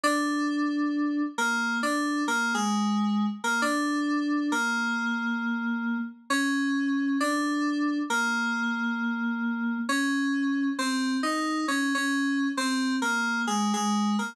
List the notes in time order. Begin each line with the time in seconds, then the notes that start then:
0.04 D4
1.38 A#3
1.83 D4
2.28 A#3
2.54 G#3
3.44 A#3
3.62 D4
4.52 A#3
6.30 C#4
7.20 D4
8.10 A#3
9.89 C#4
10.79 C4
11.23 D#4
11.68 C#4
11.95 C#4
12.57 C4
13.02 A#3
13.47 G#3
13.74 G#3
14.19 A#3